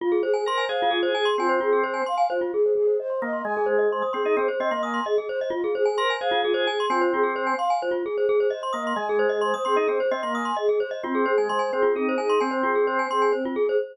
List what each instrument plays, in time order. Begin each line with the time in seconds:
0.01 flute F4, glockenspiel F4
0.12 glockenspiel G#4
0.23 flute G#4, glockenspiel C5
0.34 glockenspiel G#5
0.45 drawbar organ A#4, flute C5, glockenspiel C6
0.58 glockenspiel G#5
0.69 drawbar organ G#4, glockenspiel C5, flute F5
0.82 glockenspiel F4
0.91 flute F4, glockenspiel G#4
1.03 glockenspiel C5
1.15 flute G#4, glockenspiel G#5
1.25 glockenspiel C6
1.38 drawbar organ C4, flute F4, glockenspiel G#5
1.49 glockenspiel C5
1.61 glockenspiel F4, flute G#4
1.73 glockenspiel G#4
1.83 flute C5, glockenspiel C5
1.94 glockenspiel G#5
2.06 flute F5, glockenspiel C6
2.18 glockenspiel G#5
2.30 flute F4, glockenspiel C5
2.41 glockenspiel F4
2.53 flute G#4, glockenspiel G#4
2.66 glockenspiel C5
2.75 glockenspiel G#4, flute G#4
2.87 glockenspiel C5
2.99 flute C5, glockenspiel D#5
3.10 glockenspiel C6
3.22 drawbar organ A#3, flute D#5, glockenspiel D#6
3.33 glockenspiel C6
3.45 drawbar organ G#3, glockenspiel D#5, flute G#5
3.57 glockenspiel G#4
3.66 flute G#4, glockenspiel C5
3.79 glockenspiel D#5
3.90 flute C5, glockenspiel C6
4.02 glockenspiel D#6
4.13 drawbar organ C4, flute G#4, glockenspiel C6
4.25 drawbar organ D#4, glockenspiel D#5
4.37 drawbar organ C4, glockenspiel G#4, flute C5
4.48 glockenspiel C5
4.60 drawbar organ C4, glockenspiel D#5, flute D#5
4.71 drawbar organ A#3, glockenspiel C6
4.83 flute G#5, glockenspiel D#6
4.94 glockenspiel C6
5.06 flute G#4, glockenspiel D#5
5.18 glockenspiel G#4
5.29 glockenspiel C5, flute C5
5.41 glockenspiel D#5
5.50 glockenspiel F4, flute F4
5.64 glockenspiel G#4
5.75 flute G#4, glockenspiel C5
5.86 glockenspiel G#5
5.97 drawbar organ A#4, flute C5, glockenspiel C6
6.10 glockenspiel G#5
6.20 drawbar organ G#4, glockenspiel C5, flute F5
6.31 glockenspiel F4
6.45 flute F4, glockenspiel G#4
6.54 glockenspiel C5
6.67 flute G#4, glockenspiel G#5
6.80 glockenspiel C6
6.90 drawbar organ C4, flute F4, glockenspiel G#5
7.01 glockenspiel C5
7.13 glockenspiel F4, flute G#4
7.23 glockenspiel G#4
7.34 flute C5, glockenspiel C5
7.47 glockenspiel G#5
7.57 flute F5, glockenspiel C6
7.70 glockenspiel G#5
7.82 flute F4, glockenspiel C5
7.91 glockenspiel F4
8.05 flute G#4, glockenspiel G#4
8.18 glockenspiel C5
8.27 flute G#4, glockenspiel G#4
8.40 glockenspiel C5
8.50 flute C5, glockenspiel D#5
8.63 glockenspiel C6
8.73 drawbar organ A#3, flute D#5, glockenspiel D#6
8.87 glockenspiel C6
8.96 drawbar organ G#3, glockenspiel D#5, flute G#5
9.09 glockenspiel G#4
9.19 flute G#4, glockenspiel C5
9.29 glockenspiel D#5
9.41 flute C5, glockenspiel C6
9.54 glockenspiel D#6
9.65 drawbar organ C4, flute G#4, glockenspiel C6
9.76 drawbar organ D#4, glockenspiel D#5
9.88 drawbar organ C4, glockenspiel G#4, flute C5
10.00 glockenspiel C5
10.11 drawbar organ C4, glockenspiel D#5, flute D#5
10.23 drawbar organ A#3, glockenspiel C6
10.35 flute G#5, glockenspiel D#6
10.45 glockenspiel C6
10.57 flute G#4, glockenspiel D#5
10.69 glockenspiel G#4
10.80 glockenspiel C5, flute C5
10.91 glockenspiel D#5
11.03 drawbar organ C4, flute C4, glockenspiel F4
11.15 glockenspiel G#4
11.26 flute G#4, glockenspiel C5
11.38 drawbar organ G#3, glockenspiel G#5
11.49 drawbar organ G#3, flute C5, glockenspiel C6
11.59 glockenspiel G#5
11.73 drawbar organ C4, flute G#4, glockenspiel C5
11.82 glockenspiel F4
11.95 flute C4, drawbar organ D#4, glockenspiel G#4
12.09 glockenspiel C5
12.18 drawbar organ D#4, flute G#4, glockenspiel G#5
12.30 glockenspiel C6
12.40 flute C4, drawbar organ C4, glockenspiel G#5
12.51 glockenspiel C5
12.63 glockenspiel F4, flute G#4
12.75 glockenspiel G#4
12.87 glockenspiel C5, flute C5
12.99 glockenspiel G#5
13.10 drawbar organ C4, flute G#4, glockenspiel C6
13.22 glockenspiel G#5
13.33 flute C4, glockenspiel C5
13.45 glockenspiel F4
13.55 flute G#4, glockenspiel G#4
13.69 glockenspiel C5